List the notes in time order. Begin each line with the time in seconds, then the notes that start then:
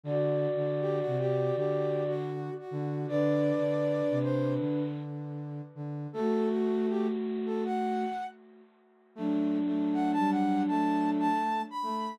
0.03 D3 F#4 D5
0.56 D3
0.81 G4
1.00 F#4
1.06 C3
1.19 G4
1.56 D3 G4
2.08 F#4
2.59 F#4
2.71 D3
3.08 D3 D4 B4 D5
3.58 D3
4.10 C3
4.23 C5
4.59 D3
5.75 D3
6.13 A3 F#4 A4
6.50 F#4
6.89 G4
7.46 A4
7.65 F#5
9.15 F#3 A3 D4
9.66 A3
9.93 F#5
10.12 A5
10.18 G3
10.31 F#5
10.68 A3 A5
11.19 A5
11.70 B5
11.83 A3